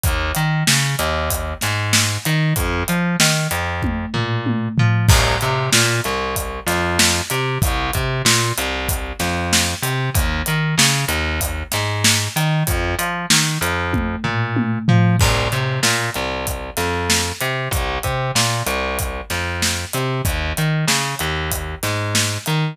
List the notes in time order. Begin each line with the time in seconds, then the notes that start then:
0.03 D#2, kick, closed hi-hat
0.35 D#3, closed hi-hat
0.67 C#3, snare
0.99 D#2, closed hi-hat
1.30 kick, closed hi-hat
1.61 G#2, snare, closed hi-hat
1.93 snare
2.25 D#3, closed hi-hat
2.56 F2, kick, closed hi-hat
2.88 F3, closed hi-hat
3.20 D#3, snare
3.51 F2, closed hi-hat
3.83 kick, high tom
4.14 A#2, floor tom
4.46 high tom
4.78 F3, floor tom
5.09 C2, kick, crash
5.41 C3, closed hi-hat
5.73 A#2, snare
6.04 C2, closed hi-hat
6.36 kick, closed hi-hat
6.66 F2, snare, closed hi-hat
6.99 snare
7.30 C3, closed hi-hat
7.62 C2, kick, closed hi-hat
7.93 C3, kick, closed hi-hat
8.25 A#2, snare
8.58 C2, closed hi-hat
8.89 kick, closed hi-hat
9.19 F2, snare, closed hi-hat
9.53 snare
9.82 C3, closed hi-hat
10.14 D#2, kick, closed hi-hat
10.46 D#3, closed hi-hat
10.78 C#3, snare
11.08 D#2, closed hi-hat
11.41 kick, closed hi-hat
11.72 G#2, snare, closed hi-hat
12.04 snare
12.36 D#3, closed hi-hat
12.67 F2, kick, closed hi-hat
12.99 F3, closed hi-hat
13.30 D#3, snare
13.61 F2, closed hi-hat
13.93 kick, high tom
14.24 A#2, floor tom
14.56 high tom
14.88 F3, floor tom
15.19 C2, kick, crash
15.52 C3, closed hi-hat
15.83 A#2, snare
16.14 C2, closed hi-hat
16.47 kick, closed hi-hat
16.77 F2, snare, closed hi-hat
17.10 snare
17.41 C3, closed hi-hat
17.71 C2, kick, closed hi-hat
18.03 C3, kick, closed hi-hat
18.35 A#2, snare
18.66 C2, closed hi-hat
18.99 kick, closed hi-hat
19.30 F2, snare, closed hi-hat
19.62 snare
19.93 C3, closed hi-hat
20.25 D#2, kick, closed hi-hat
20.57 D#3, closed hi-hat
20.88 C#3, snare
21.19 D#2, closed hi-hat
21.51 kick, closed hi-hat
21.83 G#2, snare, closed hi-hat
22.15 snare
22.46 D#3, closed hi-hat